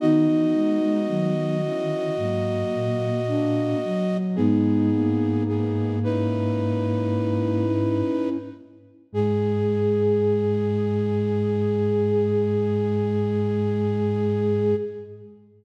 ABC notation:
X:1
M:4/4
L:1/16
Q:1/4=55
K:G#m
V:1 name="Flute"
[Fd]16 | "^rit." [B,G]4 [B,G]2 [DB]8 z2 | G16 |]
V:2 name="Flute"
[B,D]6 [CE]2 [F,A,]4 [A,=D]2 z2 | "^rit." [B,D]6 [CE]8 z2 | G16 |]
V:3 name="Flute"
D4 D,4 A,4 A,2 F,2 | "^rit." G,2 A,10 z4 | G,16 |]
V:4 name="Flute" clef=bass
D, E, G, G, F, F, D,2 G,,2 A,,4 z2 | "^rit." G,,14 z2 | G,,16 |]